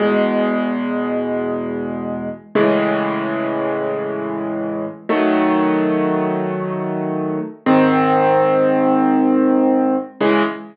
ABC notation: X:1
M:4/4
L:1/8
Q:1/4=94
K:C#m
V:1 name="Acoustic Grand Piano"
[E,,B,,G,]8 | [A,,C,E,G,]8 | [D,F,A,]8 | [G,,D,^B,]8 |
[C,E,G,]2 z6 |]